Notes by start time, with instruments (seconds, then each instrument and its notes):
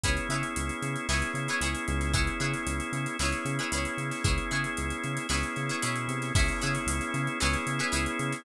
0.04 synth bass 1 C#2, drawbar organ B3 C#4 E4 G#4, pizzicato strings E4 G#4 B4 C#5, kick, closed hi-hat
0.17 snare, closed hi-hat
0.29 synth bass 1 C#3, pizzicato strings E4 G#4 B4 C#5, closed hi-hat
0.43 closed hi-hat
0.56 synth bass 1 C#2, closed hi-hat
0.69 closed hi-hat
0.82 synth bass 1 C#3, closed hi-hat
0.96 closed hi-hat
1.09 synth bass 1 C#2, drawbar organ B3 C#4 E4 G#4, pizzicato strings E4 G#4 B4 C#5, snare
1.22 closed hi-hat
1.34 synth bass 1 C#3, closed hi-hat
1.48 pizzicato strings E4 G#4 B4 C#5, closed hi-hat
1.61 synth bass 1 C#2, pizzicato strings E4 G#4 B4 C#5, closed hi-hat
1.75 closed hi-hat
1.88 synth bass 1 C#2, snare, closed hi-hat
2.01 snare, closed hi-hat
2.13 drawbar organ B3 C#4 E4 G#4, pizzicato strings E4 G#4 B4 C#5, kick, closed hi-hat
2.27 closed hi-hat
2.40 synth bass 1 C#3, pizzicato strings E4 G#4 B4 C#5, closed hi-hat
2.54 snare, closed hi-hat
2.67 synth bass 1 C#2, closed hi-hat
2.80 closed hi-hat
2.92 synth bass 1 C#3, closed hi-hat
3.06 closed hi-hat
3.19 synth bass 1 C#2, drawbar organ B3 C#4 E4 G#4, pizzicato strings E4 G#4 B4 C#5, snare
3.32 snare, closed hi-hat
3.45 synth bass 1 C#3, closed hi-hat
3.59 pizzicato strings E4 G#4 B4 C#5, closed hi-hat
3.72 synth bass 1 C#2, pizzicato strings E4 G#4 B4 C#5, closed hi-hat
3.85 snare, closed hi-hat
3.97 synth bass 1 C#3, closed hi-hat
4.11 snare, closed hi-hat
4.24 synth bass 1 C#2, drawbar organ B3 C#4 E4 G#4, pizzicato strings E4 G#4 B4 C#5, kick, closed hi-hat
4.38 closed hi-hat
4.51 synth bass 1 C#3, pizzicato strings E4 G#4 B4 C#5, closed hi-hat
4.64 closed hi-hat
4.77 synth bass 1 C#2, closed hi-hat
4.90 closed hi-hat
5.04 synth bass 1 C#3, closed hi-hat
5.17 closed hi-hat
5.29 synth bass 1 C#2, drawbar organ B3 C#4 E4 G#4, pizzicato strings E4 G#4 B4 C#5, snare
5.43 closed hi-hat
5.56 synth bass 1 C#3, snare, closed hi-hat
5.69 pizzicato strings E4 G#4 B4 C#5, closed hi-hat
5.82 synth bass 1 B2, pizzicato strings E4 G#4 B4 C#5, closed hi-hat
5.96 closed hi-hat
6.08 synth bass 1 C3, closed hi-hat
6.22 snare, closed hi-hat
6.35 synth bass 1 C#2, drawbar organ B3 C#4 E4 G#4, pizzicato strings E4 G#4 B4 C#5, kick, crash
6.48 closed hi-hat
6.61 synth bass 1 C#3, pizzicato strings E4 G#4 B4 C#5, closed hi-hat
6.75 closed hi-hat
6.86 synth bass 1 C#2, closed hi-hat
7.01 snare, closed hi-hat
7.14 synth bass 1 C#3, snare, closed hi-hat
7.27 closed hi-hat
7.40 synth bass 1 C#2, drawbar organ B3 C#4 E4 G#4, pizzicato strings E4 G#4 B4 C#5, snare
7.54 closed hi-hat
7.66 synth bass 1 C#3, closed hi-hat
7.79 pizzicato strings E4 G#4 B4 C#5, snare, closed hi-hat
7.92 synth bass 1 C#2, pizzicato strings E4 G#4 B4 C#5, closed hi-hat
8.06 closed hi-hat
8.19 synth bass 1 C#3, closed hi-hat
8.32 snare, closed hi-hat